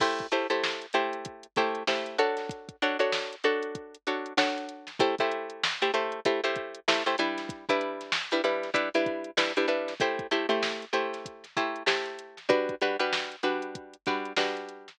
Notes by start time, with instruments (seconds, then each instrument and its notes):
0.00 pizzicato strings A3 E4 G4 C5, kick, crash
0.19 kick, closed hi-hat
0.32 pizzicato strings A3 E4 G4 C5, closed hi-hat
0.50 pizzicato strings A3 E4 G4 C5, closed hi-hat
0.64 snare
0.82 closed hi-hat
0.93 pizzicato strings A3 E4 G4 C5, closed hi-hat
1.13 closed hi-hat
1.25 kick, closed hi-hat
1.43 closed hi-hat
1.56 pizzicato strings A3 E4 G4 C5, kick, snare, closed hi-hat
1.75 closed hi-hat
1.87 pizzicato strings A3 E4 G4 C5, snare
2.06 closed hi-hat
2.18 pizzicato strings D4 F#4 A4 C#5, closed hi-hat
2.37 snare, closed hi-hat
2.49 kick, closed hi-hat
2.69 kick, closed hi-hat
2.82 pizzicato strings D4 F#4 A4 C#5, closed hi-hat
2.99 pizzicato strings D4 F#4 A4 C#5, closed hi-hat
3.12 snare
3.33 closed hi-hat
3.44 pizzicato strings D4 F#4 A4 C#5, closed hi-hat
3.63 closed hi-hat
3.75 kick, closed hi-hat
3.95 closed hi-hat
4.07 pizzicato strings D4 F#4 A4 C#5, closed hi-hat
4.26 closed hi-hat
4.37 pizzicato strings D4 F#4 A4 C#5, snare
4.58 closed hi-hat
4.69 closed hi-hat
4.87 snare, closed hi-hat
4.99 pizzicato strings A3 E4 G4 C5, kick, closed hi-hat
5.18 pizzicato strings A3 E4 G4 C5, kick, closed hi-hat
5.32 closed hi-hat
5.50 closed hi-hat
5.64 snare
5.82 pizzicato strings A3 E4 G4 C5, closed hi-hat
5.94 pizzicato strings A3 E4 G4 C5, closed hi-hat
6.12 closed hi-hat
6.25 pizzicato strings A3 E4 G4 C5, kick, closed hi-hat
6.44 pizzicato strings A3 E4 G4 C5, closed hi-hat
6.56 kick, closed hi-hat
6.75 closed hi-hat
6.88 pizzicato strings A3 E4 G4 C5, snare
7.06 pizzicato strings A3 E4 G4 C5, closed hi-hat
7.18 pizzicato strings G3 D4 E4 B4, closed hi-hat
7.38 snare, closed hi-hat
7.49 kick, closed hi-hat
7.69 pizzicato strings G3 D4 E4 B4, kick, closed hi-hat
7.81 closed hi-hat
8.01 snare, closed hi-hat
8.12 snare
8.31 pizzicato strings G3 D4 E4 B4, closed hi-hat
8.44 pizzicato strings G3 D4 E4 B4, closed hi-hat
8.63 snare, closed hi-hat
8.74 pizzicato strings G3 D4 E4 B4, kick, closed hi-hat
8.94 pizzicato strings G3 D4 E4 B4, closed hi-hat
9.06 kick, closed hi-hat
9.24 closed hi-hat
9.37 pizzicato strings G3 D4 E4 B4, snare
9.57 pizzicato strings G3 D4 E4 B4, closed hi-hat
9.68 pizzicato strings G3 D4 E4 B4, closed hi-hat
9.88 snare, closed hi-hat
10.00 pizzicato strings A3 E4 G4 C5, kick, closed hi-hat
10.19 kick, closed hi-hat
10.31 pizzicato strings A3 E4 G4 C5, closed hi-hat
10.49 pizzicato strings A3 E4 G4 C5, closed hi-hat
10.62 snare
10.82 closed hi-hat
10.93 pizzicato strings A3 E4 G4 C5, closed hi-hat
11.13 snare, closed hi-hat
11.26 kick, closed hi-hat
11.44 snare, closed hi-hat
11.57 pizzicato strings A3 E4 G4 C5, kick, closed hi-hat
11.76 closed hi-hat
11.86 pizzicato strings A3 E4 G4 C5, snare
12.06 closed hi-hat
12.19 closed hi-hat
12.37 snare, closed hi-hat
12.49 pizzicato strings G3 D4 F#4 B4, kick, closed hi-hat
12.69 kick, closed hi-hat
12.81 pizzicato strings G3 D4 F#4 B4, closed hi-hat
12.99 pizzicato strings G3 D4 F#4 B4, closed hi-hat
13.13 snare
13.32 closed hi-hat
13.43 pizzicato strings G3 D4 F#4 B4, closed hi-hat
13.62 closed hi-hat
13.75 kick, closed hi-hat
13.93 closed hi-hat
14.06 pizzicato strings G3 D4 F#4 B4, kick, snare, closed hi-hat
14.25 closed hi-hat
14.36 pizzicato strings G3 D4 F#4 B4, snare
14.57 closed hi-hat
14.69 closed hi-hat
14.88 snare, closed hi-hat